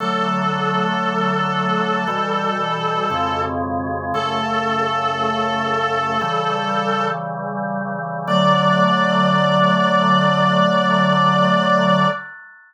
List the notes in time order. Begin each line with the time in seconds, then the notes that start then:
0.00 D3 F#3 A3 A4
2.08 B2 E3 G3
3.10 F2 B2 C#3 G#3
4.14 F#2 C#3 A3 A4
6.21 C#3 E3 G3
8.28 D3 F#3 A3 D5